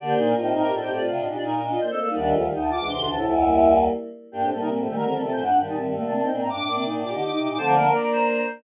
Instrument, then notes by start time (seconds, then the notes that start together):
choir aahs
0.00 D3 A#3 D4 G4 D5
0.09 C5
0.17 A#2 D#4 C5
0.27 A#4
0.35 A2 C4 D#4 F4 G4
0.45 G4
0.53 A2 D#4 A#4
0.63 A2 G4
0.71 A2 D4 F4 A4
0.80 A2 C4 D#4 G4 C5
0.90 A2 A3 C4 G4 D5
1.00 A2 F4
1.08 C3 D4 F4 F5
1.17 A2 D#5
1.26 A#2 D4 D#4 G4 D#5
1.35 A#2 D4 F4 D5
1.42 D#4 A#4
1.54 A#4
1.62 D4 D#5
1.71 D4 F4
1.80 A#3 D4 C5
1.89 A3 C4 A4 D#5
1.98 A#3 D4 A4 F5
2.08 G3 A#3 D#4
2.15 D2 D#3 G3 D4 D5
2.26 D#5
2.33 D2 F3 A3 F4
2.43 D#3 G3 F5
2.52 D2 D#4 G5
2.61 A5
2.70 D2 F4 D6
2.79 D2 E3 G#3 D4
2.88 D2 C3 E3 C6
2.97 D2 B2 D3 D4
3.06 D2 C3 E3 D4 A5
3.15 D2 A2 C3 E4
3.24 C#2 E2 F3 A3 E4 E5
3.33 E4 E5
3.42 G3 A#3
4.32 G2 A#3 D4 G4
4.42 A2 A3 C4
4.51 A2 G3 A#3 A4
4.59 C3 G3 A#3 D#4 A#4
4.68 A#2 G3 A#3 C4
4.79 A2 F3 A3
4.85 A#2 D#3 G3 A3 G4
4.95 D3 D#3 G3 A3 A#4
5.04 D3 F3 A3 C4 A#4
5.14 D#3 G3 C4 A4
5.22 C3 F3 A3 C4 A4
5.32 A#2 F3 A3 C4 C5
5.41 F#2 D4 F#5
5.51 G2
5.58 G2 D#3 G3 G5
5.67 A#2 D#3 G3 D#4 A5
5.77 A2 D#3 G3 C4
5.87 G2
5.94 A2 G3 A3 A#3 F5
6.03 C3 A3 A#3 D4 A5
6.12 C3 A#3 C4 D4 A5
6.22 C4 D#4 G5
6.31 A#2 A#3 C4 D4 G5
6.40 A2 C4 A#5
6.50 G2 D4 D6
6.59 A2
6.66 A2 A#3 D4 D6
6.74 C3 A#3 C4 D4 D6
6.85 A#2 A#3 D4 D#4
6.95 A2
7.02 A#2 D4 F4 G4 D6
7.11 D3 D#4 G4 D6
7.20 D3 D#4 G4 D6
7.30 D#4 G4 D6
7.38 C3 D#4 G4 D6
7.49 A#2 D#4 D6
7.57 D3 F3 A3 C4 C5 A5
7.67 D5 A#5
7.74 A#3 D4 A#4 A#5
7.84 A#3 D4 A#4 A#5
7.94 D5
8.03 D5
8.12 C5